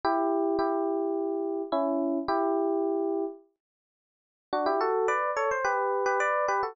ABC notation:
X:1
M:4/4
L:1/16
Q:1/4=107
K:Bm
V:1 name="Electric Piano 1"
[EG]4 [EG]8 [CE]4 | [EG]8 z8 | [K:D] [DF] [EG] [FA]2 [Bd]2 [Ac] =c [GB]3 [GB] [Bd]2 [GB] [FA] |]